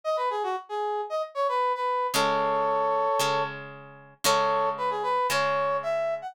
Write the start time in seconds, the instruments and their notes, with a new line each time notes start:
0.04 brass section D#5
0.17 brass section B4
0.30 brass section G#4
0.43 brass section F#4
0.69 brass section G#4
1.10 brass section D#5
1.35 brass section C#5
1.48 brass section B4
1.75 brass section B4
2.13 acoustic guitar (steel) C#3 G#3 C#4, brass section A4 C#5
3.19 acoustic guitar (steel) C#3 G#3 C#4
4.24 acoustic guitar (steel) C#3 G#3 C#4, brass section A4 C#5
4.78 brass section B4
4.90 brass section G#4
5.03 brass section B4
5.30 acoustic guitar (steel) C#3 G#3 C#4, brass section C#5
5.83 brass section E5
6.22 brass section F#5